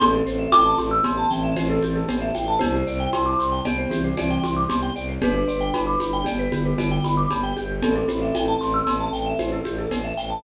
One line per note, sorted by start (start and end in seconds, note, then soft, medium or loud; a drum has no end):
0.00 0.22 A1 medium
0.00 0.96 C4 medium
0.00 0.12 G4 medium
0.00 0.96 A4 loud
0.00 0.48 C6 medium
0.00 cowbell medium
0.00 low conga medium
0.00 shaker medium
0.13 0.25 A4 medium
0.25 0.47 A1 medium
0.25 0.38 C5 medium
0.25 shaker medium
0.39 0.51 E5 medium
0.52 0.75 A1 medium
0.52 0.64 G5 medium
0.52 2.42 D6 medium
0.52 tambourine medium
0.52 cowbell medium
0.52 high conga medium
0.52 shaker medium
0.65 0.77 A5 medium
0.78 1.00 A1 medium
0.78 0.90 C6 medium
0.78 high conga medium
0.78 shaker medium
0.91 1.03 E6 medium
1.03 1.26 A1 medium
1.03 1.29 B3 medium
1.03 1.29 G4 loud
1.03 1.16 C6 medium
1.03 cowbell medium
1.03 low conga medium
1.03 shaker medium
1.17 1.29 A5 medium
1.30 1.54 A1 medium
1.30 1.55 E3 medium
1.30 1.55 C4 loud
1.30 1.42 G5 medium
1.30 shaker medium
1.44 1.55 E5 medium
1.55 1.79 A1 medium
1.55 2.03 E3 medium
1.55 2.03 C4 loud
1.55 1.68 C5 medium
1.55 tambourine medium
1.55 cowbell medium
1.55 high conga medium
1.55 shaker medium
1.70 1.82 A4 medium
1.82 2.05 A1 medium
1.82 1.94 G4 medium
1.82 high conga medium
1.82 shaker medium
1.96 2.07 A4 medium
2.08 2.32 A1 medium
2.08 2.30 B3 medium
2.08 2.30 G4 medium
2.08 2.20 C5 medium
2.08 cowbell medium
2.08 low conga medium
2.08 shaker medium
2.22 2.33 E5 medium
2.35 2.58 A1 medium
2.35 2.47 G5 medium
2.35 high conga medium
2.35 shaker medium
2.48 2.60 A5 medium
2.59 2.83 C2 medium
2.59 3.55 E4 loud
2.59 2.73 G4 medium
2.59 3.55 C5 loud
2.59 cowbell medium
2.59 low conga medium
2.59 shaker medium
2.74 2.86 C5 medium
2.85 3.07 C2 medium
2.85 2.99 D5 medium
2.85 shaker medium
3.00 3.12 G5 medium
3.13 3.35 C2 medium
3.13 3.25 C6 medium
3.13 tambourine medium
3.13 cowbell medium
3.13 high conga medium
3.13 shaker medium
3.26 3.38 D6 medium
3.39 3.61 C2 medium
3.39 3.51 C6 medium
3.39 shaker medium
3.52 3.64 G5 medium
3.64 3.86 C2 medium
3.64 3.91 B3 medium
3.64 3.91 G4 medium
3.64 3.77 D5 medium
3.64 cowbell medium
3.64 low conga medium
3.64 shaker medium
3.78 3.90 C5 medium
3.90 4.14 C2 medium
3.90 4.11 E3 medium
3.90 4.11 C4 loud
3.90 4.03 G4 medium
3.90 high conga medium
3.90 shaker medium
4.04 4.16 C5 medium
4.16 4.38 C2 medium
4.16 4.64 E3 medium
4.16 4.64 C4 medium
4.16 4.29 D5 medium
4.16 tambourine medium
4.16 cowbell medium
4.16 high conga medium
4.16 shaker medium
4.30 4.42 G5 medium
4.43 4.66 C2 medium
4.43 4.55 C6 medium
4.43 high conga medium
4.43 shaker medium
4.57 4.68 D6 medium
4.68 4.90 C2 medium
4.68 4.92 B3 medium
4.68 4.92 G4 medium
4.68 4.81 C6 medium
4.68 cowbell medium
4.68 low conga medium
4.68 shaker medium
4.83 4.94 G5 medium
4.96 5.18 C2 medium
4.96 5.07 D5 medium
4.96 shaker medium
5.09 5.21 C5 medium
5.21 5.43 G1 medium
5.21 6.21 D4 loud
5.21 5.33 G4 loud
5.21 6.21 B4 loud
5.21 cowbell medium
5.21 low conga loud
5.21 shaker medium
5.35 5.47 B4 medium
5.48 5.70 G1 medium
5.48 5.59 D5 medium
5.48 shaker medium
5.61 5.72 G5 medium
5.74 5.96 G1 medium
5.74 5.85 B5 medium
5.74 tambourine medium
5.74 cowbell medium
5.74 high conga medium
5.74 shaker medium
5.87 5.99 D6 medium
6.00 6.24 G1 medium
6.00 6.12 B5 medium
6.00 high conga medium
6.00 shaker medium
6.13 6.25 G5 medium
6.24 6.48 G1 medium
6.24 6.48 B3 medium
6.24 6.48 G4 loud
6.24 6.38 D5 medium
6.24 cowbell medium
6.24 low conga medium
6.24 shaker medium
6.39 6.51 B4 medium
6.52 6.74 G1 medium
6.52 6.74 D3 medium
6.52 6.74 B3 medium
6.52 6.64 G4 medium
6.52 high conga medium
6.52 shaker medium
6.65 6.77 B4 medium
6.77 6.99 G1 medium
6.77 7.27 D3 medium
6.77 7.27 B3 medium
6.77 6.90 D5 medium
6.77 tambourine medium
6.77 cowbell medium
6.77 high conga medium
6.77 shaker medium
6.91 7.03 G5 medium
7.04 7.26 G1 medium
7.04 7.16 B5 medium
7.04 high conga medium
7.04 shaker medium
7.17 7.29 D6 medium
7.30 7.53 G1 medium
7.30 7.51 B3 medium
7.30 7.51 G4 medium
7.30 7.42 B5 medium
7.30 cowbell medium
7.30 low conga medium
7.30 shaker medium
7.43 7.55 G5 medium
7.57 7.80 G1 medium
7.57 7.94 G4 medium
7.57 shaker medium
7.82 8.04 A1 medium
7.82 7.95 C4 loud
7.82 7.95 A4 loud
7.82 cowbell medium
7.82 low conga medium
7.82 shaker medium
7.95 8.07 C4 medium
7.95 8.07 A4 medium
8.08 8.32 A1 medium
8.08 9.66 C4 medium
8.08 9.66 A4 medium
8.08 8.21 C5 medium
8.08 high conga medium
8.08 shaker medium
8.22 8.33 E5 medium
8.34 8.56 A1 medium
8.34 8.46 G5 medium
8.34 tambourine medium
8.34 cowbell medium
8.34 high conga medium
8.34 shaker medium
8.48 8.60 A5 medium
8.60 8.82 A1 medium
8.60 8.73 C6 medium
8.60 shaker medium
8.74 8.86 E6 medium
8.86 9.09 A1 medium
8.86 8.99 C6 medium
8.86 cowbell medium
8.86 low conga medium
8.86 shaker medium
9.00 9.12 A5 medium
9.12 9.34 A1 medium
9.12 9.25 G5 medium
9.12 shaker medium
9.26 9.38 E5 medium
9.39 9.61 A1 medium
9.39 9.51 C5 medium
9.39 tambourine medium
9.39 cowbell medium
9.39 high conga medium
9.39 shaker medium
9.52 9.64 A4 medium
9.65 9.87 A1 medium
9.65 9.77 G4 medium
9.65 high conga medium
9.65 shaker medium
9.78 9.90 A4 medium
9.91 10.13 A1 medium
9.91 10.03 C5 medium
9.91 cowbell medium
9.91 low conga medium
9.91 shaker medium
10.04 10.16 E5 medium
10.17 10.40 A1 medium
10.17 10.29 G5 medium
10.17 shaker medium
10.30 10.42 A5 medium